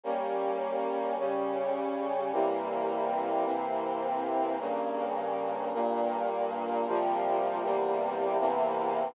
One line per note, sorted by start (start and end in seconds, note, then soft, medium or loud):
0.03 1.16 G3 medium
0.03 1.16 A#3 medium
0.03 1.16 C#4 medium
1.18 2.31 C#3 medium
1.18 2.31 G3 medium
1.18 2.31 C#4 medium
2.32 3.44 C3 medium
2.32 3.44 E3 medium
2.32 3.45 G3 medium
2.32 3.44 A#3 medium
3.45 4.57 C3 medium
3.45 4.57 E3 medium
3.45 4.57 A#3 medium
3.45 4.57 C4 medium
4.59 5.72 G2 medium
4.59 5.72 C#3 medium
4.59 5.72 A#3 medium
5.73 6.86 G2 medium
5.73 6.86 A#2 loud
5.73 6.86 A#3 medium
6.86 7.62 C3 medium
6.86 7.62 F3 loud
6.86 7.62 G3 medium
6.86 7.62 A#3 medium
7.62 8.37 E2 medium
7.62 8.37 C3 medium
7.62 8.37 G3 medium
7.62 8.37 A#3 medium
8.38 9.14 E2 medium
8.38 9.14 C3 loud
8.38 9.14 E3 medium
8.38 9.14 A#3 medium